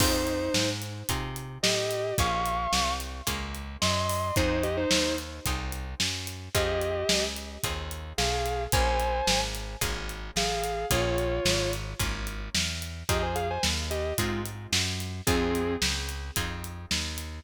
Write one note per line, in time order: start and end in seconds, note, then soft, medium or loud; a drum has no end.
0.00 0.49 F2 medium
0.00 0.98 C4 medium
0.00 0.69 D#4 medium
0.00 0.98 D#4 medium
0.00 0.98 F4 medium
0.00 0.98 G#4 medium
0.00 0.69 C5 medium
0.00 kick loud
0.00 crash loud
0.27 closed hi-hat medium
0.54 1.03 G#2 medium
0.54 snare loud
0.82 closed hi-hat medium
1.09 1.58 C3 medium
1.09 2.08 C4 medium
1.09 2.08 D#4 medium
1.09 2.08 F4 medium
1.09 2.08 G#4 medium
1.09 kick loud
1.09 closed hi-hat loud
1.36 closed hi-hat medium
1.63 2.13 A2 medium
1.63 2.14 G4 medium
1.63 2.14 D#5 medium
1.63 snare loud
1.91 closed hi-hat medium
2.18 2.67 A#1 loud
2.18 3.17 A#3 loud
2.18 3.17 C#4 medium
2.18 3.17 F4 medium
2.18 3.17 G#4 medium
2.18 2.93 F5 medium
2.18 2.93 C#6 medium
2.18 kick loud
2.18 closed hi-hat loud
2.46 closed hi-hat medium
2.73 3.22 C2 medium
2.73 snare loud
3.00 closed hi-hat medium
3.27 3.77 C#2 medium
3.27 4.25 A#3 medium
3.27 4.25 C#4 medium
3.27 4.25 F4 medium
3.27 4.25 G#4 medium
3.27 kick medium
3.27 closed hi-hat loud
3.55 closed hi-hat medium
3.81 4.31 F#2 medium
3.81 4.35 D#5 medium
3.81 4.35 C6 medium
3.81 snare loud
4.09 open hi-hat medium
4.36 4.85 F2 loud
4.36 5.35 C4 medium
4.36 4.63 D#4 medium
4.36 5.35 D#4 medium
4.36 5.35 F4 medium
4.36 5.35 G#4 medium
4.36 4.63 C5 medium
4.36 kick loud
4.36 closed hi-hat loud
4.63 4.76 G4 medium
4.63 4.76 D#5 medium
4.63 closed hi-hat medium
4.77 5.15 D#4 medium
4.77 5.15 C5 medium
4.91 5.40 D#2 medium
4.91 snare loud
5.18 closed hi-hat medium
5.45 5.95 C2 medium
5.45 6.45 C4 medium
5.45 6.45 D#4 medium
5.45 6.45 F4 medium
5.45 6.45 G#4 medium
5.45 kick medium
5.45 closed hi-hat loud
5.72 closed hi-hat medium
6.00 6.49 F#2 medium
6.00 snare loud
6.27 closed hi-hat medium
6.54 7.04 F2 loud
6.54 7.53 C4 medium
6.54 7.53 D#4 medium
6.54 7.53 F4 medium
6.54 7.24 G4 medium
6.54 7.53 G#4 medium
6.54 7.24 D#5 medium
6.54 kick loud
6.54 closed hi-hat loud
6.81 closed hi-hat medium
7.09 7.58 C#2 medium
7.09 snare loud
7.36 closed hi-hat medium
7.63 8.13 D#2 medium
7.63 8.62 C4 medium
7.63 8.62 D#4 medium
7.63 8.62 F4 medium
7.63 8.62 G#4 medium
7.63 kick medium
7.63 closed hi-hat loud
7.91 closed hi-hat medium
8.18 8.67 B1 medium
8.18 8.63 G#4 medium
8.18 8.63 F5 medium
8.18 snare loud
8.46 closed hi-hat medium
8.72 9.22 A#1 loud
8.72 9.72 A#3 medium
8.72 9.72 C#4 medium
8.72 9.72 F4 medium
8.72 9.72 G#4 loud
8.72 9.40 C5 medium
8.72 9.40 G#5 medium
8.72 kick loud
8.72 closed hi-hat loud
9.00 closed hi-hat medium
9.27 9.76 G#1 medium
9.27 snare loud
9.55 closed hi-hat medium
9.81 10.31 G#1 medium
9.81 10.80 A#3 medium
9.81 10.80 C#4 medium
9.81 10.80 F4 medium
9.81 10.80 G#4 medium
9.81 kick medium
9.81 closed hi-hat loud
10.09 closed hi-hat medium
10.36 10.85 A1 medium
10.36 10.86 G#4 medium
10.36 10.86 F5 medium
10.36 snare loud
10.64 closed hi-hat medium
10.90 11.40 A#1 loud
10.90 11.89 A#3 medium
10.90 11.89 C#4 medium
10.90 11.89 F4 medium
10.90 11.71 F4 medium
10.90 11.89 G#4 medium
10.90 11.71 C#5 medium
10.90 kick loud
10.90 closed hi-hat loud
11.18 closed hi-hat medium
11.45 11.94 G#1 medium
11.45 snare loud
11.73 closed hi-hat medium
11.99 12.49 G#1 medium
11.99 12.98 A#3 medium
11.99 12.98 C#4 medium
11.99 12.98 F4 medium
11.99 12.98 G#4 medium
11.99 kick loud
11.99 closed hi-hat loud
12.27 closed hi-hat medium
12.55 13.04 E2 medium
12.55 snare loud
12.82 closed hi-hat medium
13.09 13.58 F2 medium
13.09 14.07 C4 medium
13.09 14.07 D#4 medium
13.09 14.07 F4 medium
13.09 13.22 G4 medium
13.09 14.07 G#4 medium
13.09 13.22 D#5 medium
13.09 kick loud
13.09 closed hi-hat loud
13.22 13.35 C5 medium
13.22 13.35 G#5 medium
13.35 13.48 G#4 medium
13.35 13.48 F5 medium
13.35 closed hi-hat medium
13.50 13.63 C5 medium
13.50 13.63 G#5 medium
13.63 14.13 D#2 medium
13.63 snare loud
13.90 14.13 G4 medium
13.90 14.13 D#5 medium
13.90 closed hi-hat medium
14.18 14.67 G#2 medium
14.18 14.41 G#3 medium
14.18 15.17 C4 medium
14.18 15.17 D#4 medium
14.18 14.41 F4 medium
14.18 15.17 F4 medium
14.18 15.17 G#4 medium
14.18 kick medium
14.18 closed hi-hat loud
14.46 closed hi-hat medium
14.72 15.21 F#2 medium
14.72 snare loud
15.00 closed hi-hat medium
15.26 15.77 F2 loud
15.26 15.75 C4 medium
15.26 16.25 C4 medium
15.26 16.25 D#4 medium
15.26 16.25 F4 medium
15.26 15.75 G#4 medium
15.26 16.25 G#4 medium
15.26 kick loud
15.26 closed hi-hat loud
15.55 closed hi-hat medium
15.82 16.31 C#2 loud
15.82 snare loud
16.09 closed hi-hat medium
16.36 16.86 F2 medium
16.36 17.35 C4 medium
16.36 17.35 D#4 medium
16.36 17.35 F4 medium
16.36 17.35 G#4 medium
16.36 kick medium
16.36 closed hi-hat loud
16.64 closed hi-hat medium
16.91 17.40 D#2 medium
16.91 snare loud
17.18 closed hi-hat medium